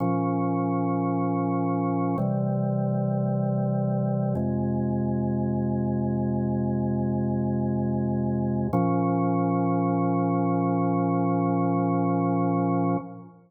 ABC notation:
X:1
M:4/4
L:1/8
Q:1/4=55
K:Bbm
V:1 name="Drawbar Organ"
[B,,F,D]4 [C,=E,=G,]4 | [F,,C,A,]8 | [B,,F,D]8 |]